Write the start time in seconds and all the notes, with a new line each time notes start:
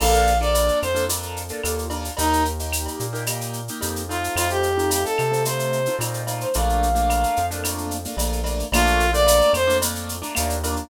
0.00 A#1 A#3 D4 F4 A4 F5, crash, cowbell, claves
0.14 shaker
0.27 shaker
0.41 A#3 D4 F4 A4 D5, shaker
0.55 cowbell, shaker
0.68 shaker
0.82 F2 C5, claves, shaker
0.95 A#3 D4 F4 A4, shaker
1.09 A#3 D4 F4 A4, cowbell, shaker
1.22 shaker
1.36 shaker
1.49 A#3 D4 F4 A4, shaker
1.63 D#2 A#3 D4 F4 A4, cowbell, claves, shaker
1.79 shaker
1.90 A#3 D4 F4 A4, cowbell, shaker
2.05 shaker
2.17 D#2 A#3 D#4 G4, cowbell, shaker
2.33 shaker
2.45 shaker
2.59 A#3 D#4 G4, shaker
2.73 claves, shaker
2.86 cowbell, shaker
3.00 A#2, shaker
3.13 A#3 D#4 G4, shaker
3.26 A#3 D#4 G4, cowbell, claves, shaker
3.41 shaker
3.53 shaker
3.68 A#3 D#4 G4, shaker
3.81 F2 A#3 D#4 G4, cowbell, shaker
3.96 shaker
4.09 A3 C4 D#4 F4, cowbell, shaker
4.24 shaker
4.36 F2 F4, cowbell, claves, shaker
4.50 G4, shaker
4.63 shaker
4.77 A3 C4 D#4 F4, shaker
4.90 G4, cowbell, shaker
5.05 A4, shaker
5.18 C3, claves, shaker
5.31 A3 C4 D#4 F4, shaker
5.45 A3 C4 D#4 F4 C5, cowbell, shaker
5.59 shaker
5.72 shaker
5.86 A3 C4 D#4 F4, shaker
5.99 A#2 A3 C4 D#4 F4, cowbell, claves, shaker
6.14 shaker
6.27 A3 C4 D#4 F4, cowbell, shaker
6.41 C5, shaker
6.54 A#1 A3 A#3 D4 F4 F5, cowbell, shaker
6.69 shaker
6.83 shaker
6.95 A3 A#3 D4 F4, shaker
7.10 cowbell, claves, shaker
7.23 shaker
7.36 F2, shaker
7.51 A3 A#3 D4 F4, shaker
7.64 A3 A#3 D4 F4, cowbell, claves, shaker
7.78 shaker
7.91 shaker
8.05 A3 A#3 D4 F4, shaker
8.17 A#1 A3 A#3 D4 F4, cowbell, shaker
8.33 shaker
8.44 A3 A#3 D4 F4, cowbell, shaker
8.60 shaker
8.72 A#1 A3 A#3 D4 F4, cowbell, claves, shaker
8.87 shaker
9.00 shaker
9.13 A3 A#3 D4 F4 D5, shaker
9.27 cowbell, shaker
9.41 shaker
9.53 F2 C5, claves, shaker
9.67 A3 A#3 D4 F4, shaker
9.82 A3 A#3 D4 F4, cowbell, shaker
9.95 shaker
10.09 shaker
10.22 A3 A#3 D4 F4, shaker
10.35 D#2 A3 A#3 D4 F4, cowbell, claves, shaker
10.50 shaker
10.64 A3 A#3 D4 F4, cowbell, shaker
10.76 shaker